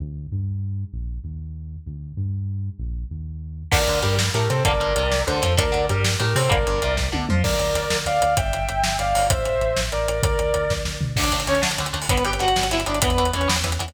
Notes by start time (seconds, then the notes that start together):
0.00 D2
0.32 G2
0.93 A#1
1.24 D#2
1.86 D2
2.17 G2
2.79 A#1
3.11 D#2
3.71 D2 D3 A3 A#4 D5, kick, crash
3.87 D2 D3, closed hi-hat
4.02 G2 G3 G4 A#4, closed hi-hat
4.19 snare
4.34 A2 A3 G4 A#4, closed hi-hat
4.49 C3 C4 A4 C5, closed hi-hat
4.65 G1 D3 G3 A#3 A#4 D5, kick, closed hi-hat
4.80 G1 G2, closed hi-hat
4.96 C2 C3, closed hi-hat
5.12 snare
5.27 D2 D3 A4 C5, closed hi-hat
5.42 F2 F3, closed hi-hat
5.57 D2 D3 A3 A#4 D5, kick, closed hi-hat
5.72 D2 D3, closed hi-hat
5.89 G2 G3 G4 A#4, closed hi-hat
6.04 snare
6.20 A2 A3 G4 A#4, closed hi-hat
6.35 C3 C4 A4 C5, open hi-hat
6.49 G1 D3 G3 A#3 A#4 D5, kick, closed hi-hat
6.66 G1 G2, closed hi-hat
6.82 C2 C3, closed hi-hat
6.97 kick, snare
7.12 D2 D3, high tom
7.29 F2 F3, mid tom
7.44 D2 A#4 D5, kick, crash
7.59 D2, closed hi-hat
7.74 D2, closed hi-hat
7.90 D2, snare
8.06 D2 D5 F5, closed hi-hat
8.22 D2, closed hi-hat
8.37 G1 E5 G5, kick, closed hi-hat
8.53 G1, closed hi-hat
8.69 G1, closed hi-hat
8.84 G1, snare
8.99 G1 D5 F5, closed hi-hat
9.15 G1, open hi-hat
9.30 A1 C5 E5, kick, closed hi-hat
9.45 A1, closed hi-hat
9.61 A1, closed hi-hat
9.76 A1, snare
9.92 A1 A#4 D5, closed hi-hat
10.07 A1, closed hi-hat
10.23 D2 A#4 D5, kick, closed hi-hat
10.39 D2, closed hi-hat
10.54 D2, closed hi-hat
10.70 D2, kick, snare
10.85 D2, snare
11.01 D2, floor tom
11.16 D2 D3 A3 D4 D5, kick, crash
11.23 closed hi-hat
11.31 D2 D3 A3, closed hi-hat
11.40 closed hi-hat
11.47 D2 D3 A3 C#4 C#5, closed hi-hat
11.55 closed hi-hat
11.62 D2 D3 A3, snare
11.71 closed hi-hat
11.78 D2 D3 A3, closed hi-hat
11.86 closed hi-hat
11.93 D2 D3 A3, closed hi-hat
12.02 open hi-hat
12.09 G1 D3 G3 B3 B4, kick, closed hi-hat
12.17 closed hi-hat
12.25 G1 D3 G3 B3 G4 G5, closed hi-hat
12.33 closed hi-hat
12.39 G1 D3 G3 B3 F#4 F#5, closed hi-hat
12.48 closed hi-hat
12.56 G1 D3 G3 B3, snare, closed hi-hat
12.63 closed hi-hat
12.71 G1 D3 G3 B3 E4 E5, closed hi-hat
12.80 closed hi-hat
12.86 G1 D3 G3 B3 D4 D5, closed hi-hat
12.95 closed hi-hat
13.02 E2 E3 B3 B4, kick, closed hi-hat
13.10 closed hi-hat
13.18 E2 E3 B3, closed hi-hat
13.25 closed hi-hat
13.33 E2 E3 B3 C#4 C#5, closed hi-hat
13.41 closed hi-hat
13.48 E2 E3 B3, snare
13.56 closed hi-hat
13.64 E2 E3 B3, closed hi-hat
13.72 closed hi-hat
13.79 E2 E3 B3, closed hi-hat
13.88 closed hi-hat